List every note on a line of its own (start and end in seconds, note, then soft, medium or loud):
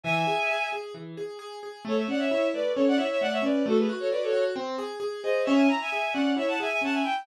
0.04 0.25 E3 loud
0.04 0.69 E5 loud
0.04 0.69 G#5 loud
0.27 0.47 G#4 medium
0.51 0.71 G#4 medium
0.72 0.93 G#4 medium
0.94 1.15 E3 medium
1.17 1.38 G#4 medium
1.39 1.59 G#4 medium
1.63 1.83 G#4 medium
1.85 2.05 A3 loud
1.85 1.98 A4 loud
1.85 1.96 C#5 loud
1.97 2.07 C#5 medium
1.97 2.07 E5 medium
2.08 2.28 C#4 medium
2.08 2.20 D5 medium
2.08 2.20 F#5 loud
2.19 2.47 C#5 medium
2.19 2.47 E5 loud
2.31 2.52 E4 medium
2.53 2.74 A3 medium
2.53 2.72 B4 medium
2.53 2.72 D5 loud
2.75 2.97 C#4 loud
2.75 2.85 A4 medium
2.75 2.85 C#5 loud
2.88 2.98 D5 loud
2.88 2.98 F#5 loud
2.97 3.18 E4 medium
2.97 3.07 C#5 medium
2.97 3.07 E5 loud
3.11 3.21 C#5 medium
3.11 3.21 E5 loud
3.21 3.42 A3 medium
3.21 3.32 D5 loud
3.21 3.32 F#5 loud
3.32 3.43 C#5 loud
3.32 3.43 E5 loud
3.42 3.63 C#4 medium
3.42 3.66 B4 medium
3.42 3.66 D5 loud
3.66 3.86 A3 loud
3.66 3.78 F#4 loud
3.66 3.78 A4 loud
3.78 3.89 G#4 medium
3.78 3.89 B4 loud
3.89 4.09 F#4 medium
4.00 4.10 A4 medium
4.00 4.10 C#5 medium
4.11 4.32 F#4 medium
4.11 4.22 B4 medium
4.11 4.22 D5 loud
4.22 4.44 A4 loud
4.22 4.44 C#5 loud
4.33 4.53 F#4 medium
4.56 4.76 C4 loud
4.78 4.99 G#4 medium
5.00 5.20 G#4 medium
5.23 5.44 G#4 medium
5.23 5.43 C5 medium
5.23 5.43 D#5 loud
5.44 5.68 C#4 loud
5.44 5.55 C#5 loud
5.44 5.55 E5 loud
5.55 5.66 E5 medium
5.55 5.66 G#5 loud
5.68 5.89 E4 medium
5.68 5.79 A#5 loud
5.81 6.14 E5 medium
5.81 6.14 G#5 loud
5.92 6.13 G#4 medium
6.13 6.35 C#4 medium
6.13 6.33 D5 medium
6.13 6.33 F#5 loud
6.37 6.57 E4 medium
6.37 6.48 C#5 medium
6.37 6.48 E5 loud
6.48 6.59 F#5 medium
6.48 6.59 A5 loud
6.60 6.80 G#4 medium
6.60 6.70 E5 loud
6.60 6.70 G#5 loud
6.70 6.81 E5 loud
6.70 6.81 G#5 loud
6.81 7.02 C#4 medium
6.81 6.94 F#5 medium
6.81 6.94 A5 loud
6.93 7.03 E5 medium
6.93 7.03 G#5 medium
7.04 7.24 E4 medium
7.04 7.23 G5 loud